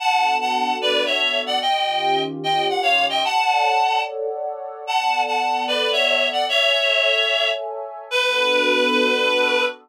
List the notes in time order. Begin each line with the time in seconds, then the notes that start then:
0.00 B3 D4 F#4 A4 F#5 A5
0.41 F#5 A5
0.81 B4 D5
1.06 C#5 E5
1.46 D5 F#5
1.61 D#3 C#4 F4 G4 D#5 G5
2.43 D#5 G5
2.69 F#5
2.83 C#5 F5
3.09 D#5 G5
3.24 A4 C#5 D5 F#5 A5
4.87 B3 A4 D5 F#5 A5
5.27 F#5 A5
5.67 B4 D5
5.92 C#5 E5
6.33 D5 F#5
6.47 A4 C#5 E5 G#5
8.11 B3 D4 F#4 A4 B4